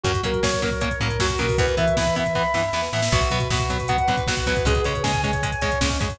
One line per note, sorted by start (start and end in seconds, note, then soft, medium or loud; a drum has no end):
0.04 0.21 F#2 medium
0.04 0.12 F#3 loud
0.04 0.12 A#3 medium
0.04 0.12 C#4 loud
0.04 0.21 F#4 medium
0.04 kick loud
0.04 closed hi-hat loud
0.14 kick medium
0.14 closed hi-hat medium
0.23 0.40 F#3 medium
0.23 0.31 F#3 medium
0.23 0.31 A#3 medium
0.23 0.31 C#4 medium
0.23 0.43 A#4 soft
0.23 kick medium
0.23 closed hi-hat medium
0.34 kick medium
0.34 closed hi-hat medium
0.43 0.92 F#3 medium
0.43 0.51 F#3 medium
0.43 0.51 A#3 medium
0.43 0.51 C#4 medium
0.43 0.61 C#5 medium
0.43 kick medium
0.43 snare loud
0.52 kick medium
0.52 closed hi-hat medium
0.62 0.70 F#3 medium
0.62 0.70 A#3 medium
0.62 0.70 C#4 medium
0.62 0.81 A#4 medium
0.62 kick medium
0.62 closed hi-hat medium
0.71 kick medium
0.71 closed hi-hat medium
0.81 0.89 F#3 medium
0.81 0.89 A#3 medium
0.81 0.89 C#4 medium
0.81 0.99 C#5 medium
0.81 kick medium
0.81 closed hi-hat loud
0.91 kick medium
0.91 closed hi-hat medium
1.00 1.17 A2 medium
1.00 1.08 F#3 medium
1.00 1.08 A#3 loud
1.00 1.08 C#4 medium
1.00 1.19 A#4 medium
1.00 kick medium
1.00 closed hi-hat medium
1.10 kick medium
1.10 closed hi-hat medium
1.19 1.36 F#2 medium
1.19 1.28 F#3 medium
1.19 1.28 A#3 medium
1.19 1.28 C#4 medium
1.19 1.39 F#4 medium
1.19 kick medium
1.19 snare loud
1.30 kick medium
1.30 closed hi-hat medium
1.38 1.56 B2 medium
1.38 1.47 F#3 medium
1.38 1.47 A#3 medium
1.38 1.47 C#4 medium
1.38 1.56 A#4 medium
1.38 kick medium
1.38 closed hi-hat medium
1.49 kick medium
1.49 open hi-hat medium
1.58 1.75 E2 medium
1.58 1.66 E3 medium
1.58 1.66 B3 loud
1.58 1.78 B4 medium
1.58 kick loud
1.58 closed hi-hat loud
1.67 kick medium
1.67 closed hi-hat medium
1.77 1.94 E3 medium
1.77 1.85 E3 medium
1.77 1.85 B3 medium
1.77 1.95 E5 soft
1.77 kick medium
1.77 closed hi-hat medium
1.88 kick medium
1.88 closed hi-hat medium
1.97 2.04 E3 medium
1.97 2.47 E3 medium
1.97 2.04 B3 medium
1.97 2.15 B5 medium
1.97 kick medium
1.97 snare loud
2.06 kick medium
2.06 closed hi-hat medium
2.16 2.24 E3 medium
2.16 2.24 B3 loud
2.16 2.33 E5 medium
2.16 kick medium
2.16 closed hi-hat medium
2.26 kick medium
2.26 closed hi-hat medium
2.35 2.43 E3 medium
2.35 2.43 B3 loud
2.35 2.53 B5 medium
2.35 kick medium
2.35 snare medium
2.54 2.70 G2 medium
2.54 2.62 E3 medium
2.54 2.62 B3 medium
2.54 2.71 E5 soft
2.54 snare medium
2.73 2.89 E2 medium
2.73 2.81 E3 medium
2.73 2.81 B3 medium
2.73 2.91 B4 medium
2.73 snare medium
2.83 snare medium
2.93 3.09 A2 medium
2.93 3.01 E3 medium
2.93 3.01 B3 medium
2.93 3.11 E5 medium
2.93 snare medium
3.02 snare loud
3.12 3.29 B1 medium
3.12 3.20 F#3 loud
3.12 3.20 B3 loud
3.12 3.30 F#4 medium
3.12 kick loud
3.12 crash loud
3.21 kick medium
3.21 closed hi-hat medium
3.30 3.48 B2 medium
3.30 3.39 F#3 medium
3.30 3.39 B3 loud
3.30 3.49 B4 medium
3.30 kick medium
3.30 closed hi-hat medium
3.40 kick medium
3.40 closed hi-hat medium
3.50 4.00 B2 medium
3.50 3.58 F#3 medium
3.50 3.58 B3 medium
3.50 3.69 F#4 medium
3.50 kick loud
3.50 snare loud
3.60 kick medium
3.60 closed hi-hat medium
3.70 3.78 F#3 loud
3.70 3.78 B3 medium
3.70 3.88 B4 medium
3.70 kick medium
3.70 closed hi-hat medium
3.79 kick medium
3.79 closed hi-hat medium
3.88 3.97 F#3 medium
3.88 3.97 B3 loud
3.88 4.06 F#5 medium
3.88 kick medium
3.88 closed hi-hat loud
3.98 kick medium
3.98 closed hi-hat medium
4.08 4.24 D2 medium
4.08 4.16 F#3 medium
4.08 4.16 B3 medium
4.08 4.27 B4 medium
4.08 kick medium
4.08 closed hi-hat medium
4.17 kick loud
4.17 closed hi-hat medium
4.27 4.44 B1 medium
4.27 4.35 F#3 medium
4.27 4.35 B3 medium
4.27 4.46 F#4 medium
4.27 kick medium
4.27 snare loud
4.37 kick medium
4.37 closed hi-hat medium
4.46 4.63 E2 medium
4.46 4.54 F#3 loud
4.46 4.54 B3 medium
4.46 4.64 B4 medium
4.46 kick medium
4.46 closed hi-hat medium
4.56 kick loud
4.56 closed hi-hat medium
4.65 4.81 C#2 medium
4.65 4.74 G#3 loud
4.65 4.74 C#4 loud
4.65 4.85 G#4 medium
4.65 kick loud
4.65 closed hi-hat loud
4.75 kick medium
4.75 closed hi-hat medium
4.84 5.02 C#3 medium
4.84 4.93 G#3 loud
4.84 4.93 C#4 loud
4.84 5.03 C#5 medium
4.84 kick medium
4.84 closed hi-hat medium
4.95 kick medium
4.95 closed hi-hat medium
5.03 5.53 C#3 medium
5.03 5.12 G#3 medium
5.03 5.12 C#4 medium
5.03 5.21 G#5 medium
5.03 kick medium
5.03 snare loud
5.13 kick medium
5.13 closed hi-hat medium
5.23 5.31 G#3 loud
5.23 5.31 C#4 medium
5.23 5.42 C#5 medium
5.23 kick medium
5.23 closed hi-hat medium
5.33 kick medium
5.33 closed hi-hat medium
5.43 5.51 G#3 loud
5.43 5.51 C#4 medium
5.43 5.62 G#5 medium
5.43 kick medium
5.43 closed hi-hat loud
5.52 kick medium
5.52 closed hi-hat medium
5.61 5.78 E2 medium
5.61 5.70 G#3 medium
5.61 5.70 C#4 medium
5.61 5.79 C#5 medium
5.61 kick medium
5.61 closed hi-hat medium
5.71 kick medium
5.71 closed hi-hat medium
5.81 5.98 C#2 medium
5.81 5.89 G#3 medium
5.81 5.98 C#4 medium
5.81 5.89 C#4 loud
5.81 kick loud
5.81 snare loud
5.90 kick medium
5.90 closed hi-hat medium
6.00 6.17 F#2 medium
6.00 6.08 G#3 medium
6.00 6.08 C#4 medium
6.00 6.17 C#5 medium
6.00 kick loud
6.00 closed hi-hat medium
6.10 kick medium
6.10 open hi-hat medium